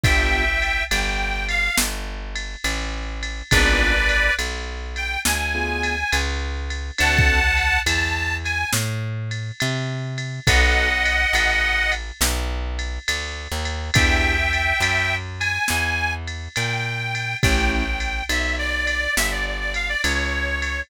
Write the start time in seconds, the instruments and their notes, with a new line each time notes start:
0.04 electric bass (finger) G1, acoustic grand piano B3 D4 F4 G4, harmonica E5 G5, kick, ride
0.62 ride
0.90 electric bass (finger) G1, harmonica G5, ride
1.49 harmonica F5, ride
1.78 electric bass (finger) G1, snare
2.36 ride
2.64 electric bass (finger) A1, ride
3.23 ride
3.51 electric bass (finger) G#1, acoustic grand piano B3 D4 F4 G#4, harmonica B4 D5, kick, ride
4.09 ride
4.39 electric bass (finger) B1, ride
4.96 harmonica G5, ride
5.25 electric bass (finger) D2, harmonica G#5, snare
5.55 acoustic grand piano B3 D4 F4 G#4
5.83 ride
6.12 electric bass (finger) C#2, ride
6.70 ride
6.98 electric bass (finger) D2, acoustic grand piano C4 D4 F#4 A4, harmonica F#5 A5, ride
7.19 kick
7.57 ride
7.86 electric bass (finger) E2, harmonica A5, ride
8.44 harmonica G#5, ride
8.73 electric bass (finger) A2, snare
9.31 ride
9.60 electric bass (finger) C3, ride
10.18 ride
10.47 electric bass (finger) B1, acoustic grand piano B3 D#4 F#4 A4, harmonica D#5 F#5, kick, ride
11.05 ride
11.33 electric bass (finger) A1, ride
11.92 ride
12.21 electric bass (finger) B1, snare
12.79 ride
13.08 electric bass (finger) D2, ride
13.52 electric bass (finger) D#2
13.65 ride
13.94 electric bass (finger) E2, acoustic grand piano B3 D4 E4 G4, harmonica E5 G5, kick, ride
14.53 ride
14.80 electric bass (finger) F#2, ride
15.40 harmonica G#5, ride
15.68 electric bass (finger) E2, snare
16.28 ride
16.56 electric bass (finger) A#2, harmonica G5, ride
17.15 ride
17.43 electric bass (finger) A1, acoustic grand piano A3 C#4 E4 G4, harmonica G5, kick, ride
17.72 harmonica G5
18.00 ride
18.29 electric bass (finger) B1, harmonica E5, ride
18.59 harmonica D5
18.87 ride
19.17 electric bass (finger) G1, harmonica E5, snare
19.32 harmonica D5
19.46 harmonica D5
19.60 harmonica D5
19.74 harmonica F5, ride
19.89 harmonica D5
20.03 electric bass (finger) C#2, harmonica C#5, ride
20.62 ride